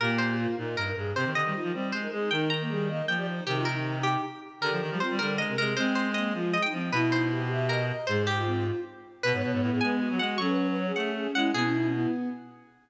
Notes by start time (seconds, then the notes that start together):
0.00 A#2 A#3 G4 A#4
0.18 C5
0.38 F4
0.57 A#2 D#4 A#4
0.77 G2 A#4
0.87 A#4
0.96 G2 G#4
1.14 C3 C4 G4 C5
1.25 D#3
1.35 D3 D#5
1.44 D#3 G3
1.54 D#3 F4
1.63 F3
1.73 G3 C4 C5
1.92 G#3 C5
2.01 D#4 A#4
2.11 G#3 D#4 G#4
2.31 D#3 D#4 A#4 G5
2.50 A#5
2.60 A#3
2.69 G3 G#4
2.89 A#3 D#5
3.07 F3 G5
3.17 G4 D5
3.27 D#4 C5
3.46 C3 D#3 G4
3.56 F4
3.65 D#4 A#4
3.94 D#4
4.03 G4
4.61 D3 G4 A#4
4.71 F3
4.81 D#3
4.90 F3 G3
5.00 C4 F4 C5
5.10 G3
5.19 D3 G3 A#4
5.38 G#3 D#5
5.48 C3 A#4
5.57 C3 G#3 G#4 A#4
5.77 G#3 C4 C5
5.95 C5
6.14 A#3 D#5
6.34 F3 G#3 F4
6.53 D#5
6.62 D#4 G5
6.72 F3 C4
6.92 B2 E4 B4
7.11 D#4 C5
7.31 G4
7.50 G4 E5
7.69 A#4 D#5
7.89 D#5
8.07 G#2 G#3 G#4 C5
8.27 G4
8.36 F4
8.46 C4
9.23 B2 B3 B4
9.33 G#2 C#5
9.42 B2 C#5
9.52 G#2 C#5
9.61 A2 B4
9.71 A2 G#4
9.81 G#3 G#5
10.00 F#4
10.10 F#3
10.19 G#3 F#4 F#5
10.38 F#3 C#4 A4 C#6
10.48 B4
10.58 B4
10.67 B4
10.77 C#5
10.86 G#4
10.96 A3 F#5
11.15 G#4
11.35 G#3 E4 F#5
11.53 B2 B3 E4 G#4
11.64 C#4
11.73 D#4
11.83 C#4
11.92 B3 E4